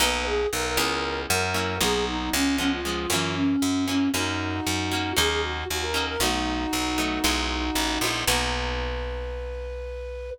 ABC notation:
X:1
M:4/4
L:1/16
Q:1/4=116
K:B
V:1 name="Flute"
B2 G2 A A5 A4 G2 | D2 C2 C ^E5 C4 C2 | [DF]8 G G F2 F A2 A | [DF]16 |
B16 |]
V:2 name="Acoustic Guitar (steel)"
[A,B,DF]6 [G,B,CE]6 [F,A,CE]2 [F,A,B,D]2- | [F,A,B,D]4 [^E,G,B,C]2 [E,G,B,C]2 [=E,F,A,C]6 [E,F,A,C]2 | [F,A,C]6 [F,A,C]2 [F,A,CD]6 [F,A,CD]2 | [F,=A,B,D]6 [F,A,B,D]2 [G,B,DE]6 [G,B,DE]2 |
[A,B,DF]16 |]
V:3 name="Electric Bass (finger)" clef=bass
B,,,4 B,,,2 C,,4 F,,4 B,,,2- | B,,,2 C,,6 F,,4 F,,4 | F,,4 F,,4 D,,4 D,,4 | B,,,4 B,,,4 B,,,4 =A,,,2 ^A,,,2 |
B,,,16 |]